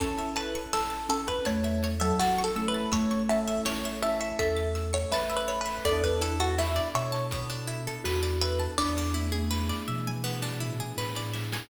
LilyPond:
<<
  \new Staff \with { instrumentName = "Harpsichord" } { \time 4/4 \key a \major \tempo 4 = 82 a'8 b'8 a'8 a'16 b'16 cis''8. a'16 \tuplet 3/2 { fis'8 a'8 b'8 } | cis''8 e''8 cis''8 e''16 e''16 e''8. cis''16 \tuplet 3/2 { b'8 b'8 b'8 } | d''16 b'16 a'16 fis'16 e'8 cis''2 b'8 | d''2.~ d''8 r8 | }
  \new Staff \with { instrumentName = "Marimba" } { \time 4/4 \key a \major cis'4. cis'8 a8. fis8. a8 | a2 a'4 e''4 | a'2. fis'4 | d'2 r2 | }
  \new Staff \with { instrumentName = "Electric Piano 1" } { \time 4/4 \key a \major <cis' e' a'>2.~ <cis' e' a'>8 <cis' e' a'>8~ | <cis' e' a'>8 <cis' e' a'>4 <cis' e' a'>2~ <cis' e' a'>8 | <b d' e' a'>1 | r1 | }
  \new Staff \with { instrumentName = "Pizzicato Strings" } { \time 4/4 \key a \major cis''16 e''16 a''16 cis'''16 e'''16 a'''16 e'''16 cis'''16 a''16 e''16 cis''16 e''16 a''16 cis'''16 e'''16 a'''16 | e'''16 cis'''16 a''16 e''16 cis''16 e''16 a''16 cis'''16 e'''16 a'''16 e'''16 cis'''16 a''16 e''16 cis''16 e''16 | b16 d'16 e'16 a'16 b'16 d''16 e''16 a''16 b16 d'16 e'16 a'16 b'16 d''16 e''16 a''16 | b16 d'16 e'16 gis'16 b'16 d''16 e''16 gis''16 b16 d'16 e'16 gis'16 b'16 d''16 e''16 gis''16 | }
  \new Staff \with { instrumentName = "Synth Bass 1" } { \clef bass \time 4/4 \key a \major a,,4 a,,4 e,4 a,,4 | a,,4 a,,4 e,4 a,,4 | e,4. b,4. e,4 | e,4. b,4. a,4 | }
  \new Staff \with { instrumentName = "Pad 5 (bowed)" } { \time 4/4 \key a \major <cis' e' a'>1 | <a cis' a'>1 | <b d' e' a'>1 | <b d' e' gis'>1 | }
  \new DrumStaff \with { instrumentName = "Drums" } \drummode { \time 4/4 <hh bd>16 hh16 hh16 hh16 sn16 hh16 hh16 <hh bd>16 <hh bd>16 hh16 hh16 hh16 sn16 <hh sn>16 hh16 hh16 | <hh bd>16 hh16 hh16 hh16 sn16 hh16 hh16 hh16 <hh bd>16 hh16 hh16 hh16 sn16 <hh sn>16 hh16 hho16 | <hh bd>16 <hh bd>16 hh16 hh16 sn16 hh16 hh16 <hh sn>16 <hh bd>16 hh16 hh16 hh16 sn16 <hh sn>16 hh16 hh16 | <bd sn>16 sn16 tommh16 tommh16 sn16 sn16 toml16 toml16 sn16 sn16 tomfh16 tomfh16 sn16 sn16 sn16 sn16 | }
>>